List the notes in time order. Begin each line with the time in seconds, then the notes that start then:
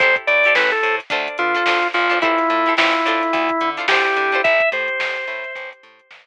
0.00 A1 E4 G4 A4 C5, kick, closed hi-hat
0.16 kick, closed hi-hat
0.27 A2 D5, closed hi-hat
0.44 E4 G4 A4, closed hi-hat
0.48 C5
0.55 A1 E4 G4 A4 B4, snare
0.59 C5
0.71 A4, closed hi-hat
0.83 A2, closed hi-hat
1.00 closed hi-hat
1.10 D2 D4 F4 A4 C5, kick, closed hi-hat
1.28 closed hi-hat
1.38 D3 F4, closed hi-hat
1.55 D4 F4 A4 C5, closed hi-hat
1.66 D2 D4 F4 A4 C5, snare
1.83 closed hi-hat
1.94 A1 F4, closed hi-hat
2.10 D4 F4 A4 C5, closed hi-hat
2.22 E4 G4 A4 C5, kick, closed hi-hat
2.38 snare, closed hi-hat
2.50 A2, snare, closed hi-hat
2.66 E4 G4 A4 C5, snare, closed hi-hat
2.77 A1 E4 G4 A4 C5, snare
2.93 snare, closed hi-hat
3.05 A2 D4 F4 A4 C5, closed hi-hat
3.23 closed hi-hat
3.33 D2, kick, closed hi-hat
3.49 kick, closed hi-hat
3.61 D3, closed hi-hat
3.77 D4 F4 A4 C5, closed hi-hat
3.88 D2 D4 F4 G4 A4 C5, snare
4.05 closed hi-hat
4.16 D3, closed hi-hat
4.32 D4 F4 A4 C5, closed hi-hat
4.44 A1 E5, kick, closed hi-hat
4.60 kick, closed hi-hat
4.72 A2 C5, closed hi-hat
4.88 closed hi-hat
5.00 A1, snare
5.16 closed hi-hat
5.27 A2, closed hi-hat
5.44 closed hi-hat
5.55 A1, kick, closed hi-hat
5.73 closed hi-hat
5.83 A2, closed hi-hat
5.99 closed hi-hat
6.11 A1, snare